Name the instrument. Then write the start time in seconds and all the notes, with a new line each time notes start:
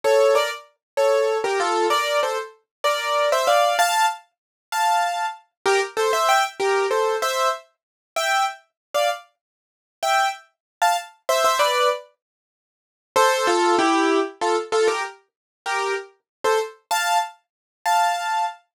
acoustic grand piano
0.04 A4 C#5
0.35 A#4 D5
0.97 A4 C#5
1.44 G4 A#4
1.60 F4 A4
1.90 A#4 D5
2.23 A4 C5
2.84 A#4 D5
3.32 C5 E5
3.47 D5 F5
3.79 F5 A5
4.72 F5 A5
5.66 G4 A#4
5.97 A4 C5
6.13 C5 E5
6.29 E5 G5
6.60 G4 A#4
6.91 A4 C5
7.22 C5 E5
8.16 E5 G5
8.94 D5 F5
10.03 E5 G5
10.82 F5 A5
11.29 C5 E5
11.44 C5 E5
11.59 B4 D5
13.16 A4 C5
13.47 F4 A4
13.79 E4 G4
14.41 F4 A4
14.72 F4 A4
14.88 G4 A#4
15.66 G4 A#4
16.44 A4 C5
16.91 F5 A5
17.86 F5 A5